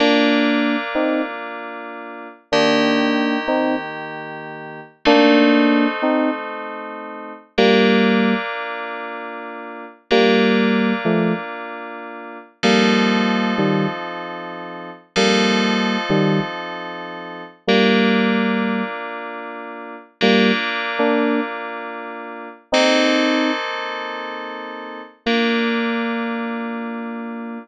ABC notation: X:1
M:4/4
L:1/16
Q:1/4=95
K:Bb
V:1 name="Electric Piano 2"
[B,D]6 [CE]2 z8 | [B,D]6 [CE]2 z8 | [B,D]6 [CE]2 z8 | [G,B,]6 z10 |
[G,B,]6 [F,A,]2 z8 | [G,B,]6 [E,G,]2 z8 | [G,B,]6 [E,G,]2 z8 | [G,B,]8 z8 |
[G,B,]2 z3 [B,D]3 z8 | [CE]6 z10 | B,16 |]
V:2 name="Electric Piano 2"
[B,DF]16 | [E,B,G]16 | [A,CE]16 | [B,DF]16 |
[B,DF]16 | [F,CEA]16 | [F,CEA]16 | [B,DF]16 |
[B,DF]16 | [B,CEA]16 | [B,DF]16 |]